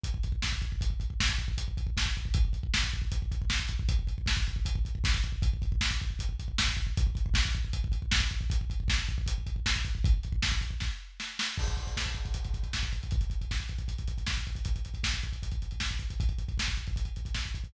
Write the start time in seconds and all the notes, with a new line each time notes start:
0.04 kick, closed hi-hat
0.14 kick
0.23 kick, closed hi-hat
0.32 kick
0.42 kick, snare
0.52 kick
0.62 kick, closed hi-hat
0.72 kick
0.81 kick, closed hi-hat
0.90 kick
1.00 kick, closed hi-hat
1.10 kick
1.20 kick, snare
1.29 kick
1.38 kick, closed hi-hat
1.48 kick
1.58 kick, closed hi-hat
1.68 kick
1.77 kick, closed hi-hat
1.87 kick
1.97 kick, snare
2.06 kick
2.15 kick, closed hi-hat
2.25 kick
2.34 kick, closed hi-hat
2.45 kick
2.53 kick, closed hi-hat
2.63 kick
2.74 kick, snare
2.84 kick
2.93 kick, closed hi-hat
3.02 kick
3.12 kick, closed hi-hat
3.22 kick
3.32 kick, closed hi-hat
3.42 kick
3.50 kick, snare
3.59 kick
3.68 kick, closed hi-hat
3.79 kick
3.89 kick, closed hi-hat
3.99 kick
4.07 kick, closed hi-hat
4.18 kick
4.26 kick, snare
4.37 kick
4.47 kick, closed hi-hat
4.56 kick
4.65 kick, closed hi-hat
4.75 kick
4.85 kick, closed hi-hat
4.95 kick
5.04 kick, snare
5.14 kick
5.23 kick, closed hi-hat
5.32 kick
5.42 kick, closed hi-hat
5.53 kick
5.62 kick, closed hi-hat
5.72 kick
5.81 kick, snare
5.91 kick
6.00 kick, closed hi-hat
6.10 kick
6.19 kick, closed hi-hat
6.29 kick
6.39 kick, closed hi-hat
6.48 kick
6.58 kick, snare
6.68 kick
6.77 kick, closed hi-hat
6.87 kick
6.97 kick, closed hi-hat
7.07 kick
7.15 kick, closed hi-hat
7.26 kick
7.34 kick, snare
7.45 kick
7.53 kick, closed hi-hat
7.65 kick
7.73 kick, closed hi-hat
7.84 kick
7.92 kick, closed hi-hat
8.02 kick
8.11 kick, snare
8.20 kick
8.30 kick, closed hi-hat
8.41 kick
8.50 kick, closed hi-hat
8.61 kick
8.70 kick, closed hi-hat
8.80 kick
8.88 kick, snare
8.99 kick
9.08 kick, closed hi-hat
9.18 kick
9.26 kick, closed hi-hat
9.38 kick
9.47 kick, closed hi-hat
9.56 kick
9.66 kick, snare
9.76 kick
9.85 kick, closed hi-hat
9.95 kick
10.04 kick, closed hi-hat
10.14 kick
10.23 kick, closed hi-hat
10.32 kick
10.42 kick, snare
10.52 kick
10.61 kick, closed hi-hat
10.71 kick
10.80 kick, snare
11.20 snare
11.39 snare
11.58 kick, crash
11.68 kick, closed hi-hat
11.77 kick, closed hi-hat
11.87 kick, closed hi-hat
11.97 kick, snare
12.06 kick, closed hi-hat
12.15 kick, closed hi-hat
12.25 kick, closed hi-hat
12.34 kick, closed hi-hat
12.44 kick, closed hi-hat
12.54 kick, closed hi-hat
12.63 kick, closed hi-hat
12.73 kick, snare
12.83 kick, closed hi-hat
12.92 kick, closed hi-hat
13.03 kick, closed hi-hat
13.11 kick, closed hi-hat
13.21 kick, closed hi-hat
13.30 kick, closed hi-hat
13.41 kick, closed hi-hat
13.51 kick, snare
13.60 kick, closed hi-hat
13.69 kick, closed hi-hat
13.78 kick, closed hi-hat
13.88 kick, closed hi-hat
13.98 kick, closed hi-hat
14.08 kick, closed hi-hat
14.18 kick, closed hi-hat
14.27 kick, snare
14.36 kick, closed hi-hat
14.47 kick, closed hi-hat
14.55 kick, closed hi-hat
14.65 kick, closed hi-hat
14.76 kick, closed hi-hat
14.85 kick, closed hi-hat
14.94 kick, closed hi-hat
15.03 kick, snare
15.14 kick, closed hi-hat
15.23 kick, closed hi-hat
15.33 kick, closed hi-hat
15.43 kick, closed hi-hat
15.51 kick, closed hi-hat
15.62 kick, closed hi-hat
15.71 kick, closed hi-hat
15.80 kick, snare
15.91 kick, closed hi-hat
15.99 kick, closed hi-hat
16.10 kick, closed hi-hat
16.20 kick, closed hi-hat
16.29 kick, closed hi-hat
16.38 kick, closed hi-hat
16.48 kick, closed hi-hat
16.58 kick, snare
16.67 kick, closed hi-hat
16.77 kick, closed hi-hat
16.87 kick, closed hi-hat
16.96 kick, closed hi-hat
17.05 kick, closed hi-hat
17.16 kick, closed hi-hat
17.25 kick, closed hi-hat
17.35 kick, snare
17.45 kick, closed hi-hat
17.54 kick, closed hi-hat
17.64 kick, closed hi-hat